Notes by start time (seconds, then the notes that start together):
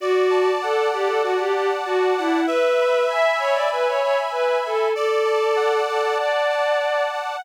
0.00 F#4 D5
0.29 A5
0.61 A4 F#5
0.91 G4 A5
1.07 A4
1.23 F#4 D5
1.39 G4
1.55 G4 A5
1.85 F#4 A5
2.17 E4 F#5
2.47 B4 E5
2.80 B5
3.09 E5 G#5
3.39 C#5 B5
3.53 D5
3.71 B4 E5
3.88 C#5
4.01 C#5 B5
4.31 B4 B5
4.65 A4 G#5
4.94 A4 D5
5.24 A5
5.56 F#5
5.87 A4 A5
6.18 D5
6.49 A5
6.79 A5
7.12 F#5